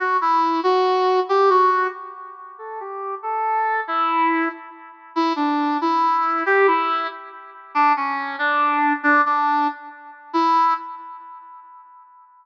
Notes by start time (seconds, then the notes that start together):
0.00 F#4
0.21 E4
0.63 F#4
1.29 G4
1.50 F#4
2.58 A4
2.80 G4
3.23 A4
3.88 E4
5.16 E4
5.36 D4
5.81 E4
6.46 G4
6.67 E4
7.75 D4
7.97 C#4
8.39 D4
9.03 D4
9.26 D4
10.33 E4